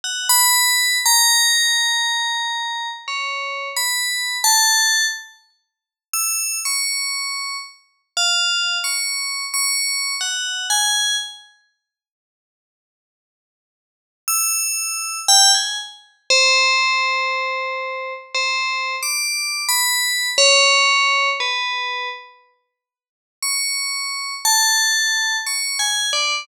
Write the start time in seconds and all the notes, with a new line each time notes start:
0.04 F#5
0.29 B5
1.06 A#5
3.08 C#5
3.77 B5
4.44 A5
6.14 E6
6.65 C#6
8.17 F5
8.84 C#6
9.54 C#6
10.21 F#5
10.70 G#5
14.28 E6
15.28 G5
15.55 G#5
16.30 C5
18.35 C5
19.03 D6
19.69 B5
20.38 C#5
21.40 B4
23.43 C#6
24.45 A5
25.47 C#6
25.79 G#5
26.13 D5